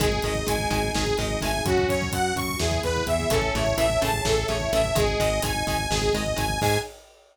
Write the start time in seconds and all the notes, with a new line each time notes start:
0.00 G#1 D#3 G#3 D#4 G#4, kick, closed hi-hat
0.12 kick
0.22 G#1 D#3 G#3 D#5, kick, closed hi-hat
0.35 kick
0.46 G#1 D#3 G#3 G#5, kick, closed hi-hat
0.59 kick
0.70 G#1 D#3 G#3 G#5, kick, closed hi-hat
0.84 kick
0.94 G#1 D#3 G#3 G#4, kick, snare
1.06 kick
1.18 G#1 D#3 G#3 D#5, kick, closed hi-hat
1.30 kick
1.41 G#1 D#3 G#3 A3 G#5, kick, closed hi-hat
1.54 kick
1.65 F#2 C#4 F#4, kick, closed hi-hat
1.78 kick
1.89 F#2 C#5, kick, closed hi-hat
2.02 kick
2.12 F#2 F#5, kick, closed hi-hat
2.36 F#2 C#6, kick, closed hi-hat
2.49 kick
2.59 E2 E3 B3 E4 G#4, kick, snare
2.71 kick
2.83 E2 B4, kick, closed hi-hat
2.96 kick
3.06 E2 E3 E5, kick, closed hi-hat
3.20 kick
3.30 A1 C#3 E3 A3 C#4 A4 C#5 E5 A5, kick, closed hi-hat
3.42 kick
3.54 A1 C#3 E3 A3 E4 C#5, kick, closed hi-hat
3.66 kick
3.77 A1 C#3 E3 A3 E5, kick, closed hi-hat
3.90 kick
4.01 A1 C#3 E3 A3 G#4 A5, kick, closed hi-hat
4.13 kick
4.25 A1 C#3 E3 A3 A4, kick, snare
4.37 kick
4.48 A1 C#3 E3 A3 C#5, kick, closed hi-hat
4.60 E4, kick
4.72 A1 C#3 E3 A3 E4 E5, kick, closed hi-hat
4.84 kick
4.95 G#1 D#3 G#3 G#4 D#5 G#5, kick, closed hi-hat
5.07 kick
5.20 G#1 D#3 G#3 D#5, kick, closed hi-hat
5.42 G#1 D#3 G#3 D#4 G#5, kick, closed hi-hat
5.55 kick
5.67 G#1 D#3 G#3 G#5, kick, closed hi-hat
5.79 kick
5.90 G#1 D#3 G#3 G#4, kick, snare
6.02 kick
6.13 G#1 D#3 G#3 D#5, kick, closed hi-hat
6.26 kick
6.36 G#1 D#3 G#3 G#5, kick, closed hi-hat
6.49 kick
6.61 G#2 D#3 G#3 D#4 G#4 G#5, kick, crash